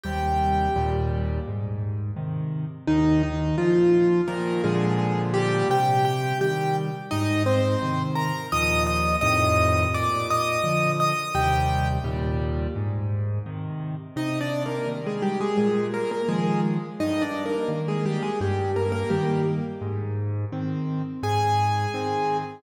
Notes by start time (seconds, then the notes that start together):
0.04 D#2 C3 G3 G4 G5
0.76 D#2 A#2 G3
1.47 G#2
2.16 C3 D#3
2.87 D#2 D#3 D#4
3.23 D#3 D#4
3.58 A#2 F3 F4
4.28 A#2 D#3 F3 A#3 A#4
4.64 A#2 D3 F3 G#3 G#4
5.34 G3 G4
5.69 C3 G4 G5
6.05 G4 G5
6.41 D#3 G3 G4 G5
7.11 G#2 D#4 D#5
7.46 C4 C5
7.82 C3 D#3
8.15 A#4 A#5
8.52 D#2 A#2 F3 D#5 D#6
8.87 D#5 D#6
9.21 F2 A2 C3 D#3 D#5 D#6
9.94 A#2 D5 D6
10.30 D#5 D#6
10.64 D3 F3
11.00 D#5 D#6
11.35 D#2 C3 G3 G4 G5
12.04 D#2 A#2 G3
12.76 G#2
13.46 C3 D#3
14.16 C3 D#4 D#5
14.41 D4 D5
14.66 A#3 A#4
14.87 D#3 G3
15.06 G#3 G#4
15.22 G3 G4
15.41 G#3 G#4
15.57 A#2 G#3 G#4
15.94 A#3 A#4
16.11 A#3 A#4
16.29 D#3 F3 G#3 G#4
17.00 G2 D#4 D#5
17.22 D4 D5
17.46 A#3 A#4
17.68 D#3 A#3
17.88 G#3 G#4
18.06 G3 G4
18.23 G#3 G#4
18.41 G2 G3 G4
18.76 A#3 A#4
18.92 A#3 A#4
19.10 D#3 G3 A#3 G4
19.81 G#2
20.52 D#3 C4
21.23 G#2 G#4 G#5
21.94 D#3 C4